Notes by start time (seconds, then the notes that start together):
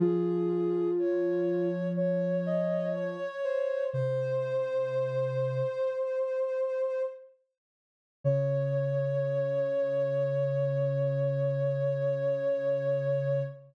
0.00 F3 F4 G#4
0.98 C#5
1.96 C#5
2.46 D#5
2.95 C#5
3.44 C5
3.92 C3 C5
8.24 C#3 C#5